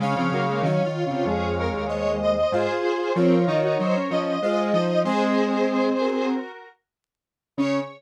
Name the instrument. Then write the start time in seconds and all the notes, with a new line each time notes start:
lead 1 (square)
0.00 C#3 G#3 C#4 C#5 F5
0.16 C#3 F3 C4
0.32 C#3 F#3 A#3
0.47 G#3 A#3
0.63 D#3 F#3 C#4 C#5 F5
0.84 D#3 F4
1.05 C#3 F4
1.10 C3
1.25 F2 G#3 G#4
1.58 A#4
1.73 D#2
1.87 C5 C#5 D#5
2.22 D#5
2.37 D#5
2.52 G#2 F4 G#4 C5
3.14 F3 C4 F4 A#4 C#5
3.46 D#3 D#4
3.63 D#4 F#4
3.79 F#3 D#4 C5
3.95 C#4
4.10 F3 C#4 D#5
4.42 G#3 F4 C5 D#5
4.73 F3 D#4 D#5
5.05 G#3 C4 G#4 C5
6.00 F#4 A#4
7.57 C#3 C#4 C#5